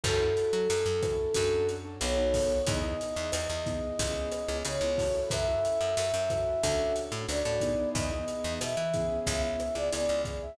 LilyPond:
<<
  \new Staff \with { instrumentName = "Flute" } { \time 4/4 \key fis \minor \tempo 4 = 91 a'2. cis''4 | dis''2. cis''4 | e''2. d''4 | dis''4 e''4 e''16 e''8 d''16 d''8 r16 e''16 | }
  \new Staff \with { instrumentName = "Acoustic Grand Piano" } { \time 4/4 \key fis \minor <cis' e' fis' a'>16 <cis' e' fis' a'>4~ <cis' e' fis' a'>16 <cis' e' fis' a'>8 <cis' d' fis' a'>8. <cis' d' fis' a'>16 <b dis' fis' a'>16 <b dis' fis' a'>8. | <b dis' e' gis'>16 <b dis' e' gis'>4~ <b dis' e' gis'>16 <b dis' e' gis'>8 <b cis' e' gis'>8. <b cis' e' gis'>16 <b cis' e' gis'>16 <b cis' e' gis'>16 <cis' e' fis' a'>8~ | <cis' e' fis' a'>16 <cis' e' fis' a'>4~ <cis' e' fis' a'>16 <cis' e' fis' a'>8 <cis' d' fis' a'>8. <cis' d' fis' a'>16 <cis' d' fis' a'>16 <cis' d' fis' a'>16 <b dis' e' gis'>8~ | <b dis' e' gis'>16 <b dis' e' gis'>4~ <b dis' e' gis'>16 <b cis' e' gis'>4~ <b cis' e' gis'>16 <b cis' e' gis'>16 <b cis' e' gis'>16 <b cis' e' gis'>8. | }
  \new Staff \with { instrumentName = "Electric Bass (finger)" } { \clef bass \time 4/4 \key fis \minor fis,8. fis16 fis,16 fis,8. fis,4 b,,4 | e,8. e,16 e,16 e,8. cis,8. cis,16 cis16 cis,8. | fis,8. fis,16 fis,16 fis,8. d,8. a,16 d,16 a,8. | e,8. e,16 b,16 e8. cis,8. cis,16 cis,16 cis,8. | }
  \new DrumStaff \with { instrumentName = "Drums" } \drummode { \time 4/4 <cymc bd ss>8 hh8 hh8 <hh bd ss>8 <hh bd>8 hh8 <hh ss>8 <hho bd>8 | <hh bd>8 hh8 <hh ss>8 <hh bd>8 <hh bd>8 <hh ss>8 hh8 <hho bd>8 | <hh bd ss>8 hh8 hh8 <hh bd ss>8 <hh bd>8 hh8 <hh ss>8 <hh bd>8 | <hh bd>8 hh8 <hh ss>8 <hh bd>8 <hh bd>8 <hh ss>8 hh8 <hh bd>8 | }
>>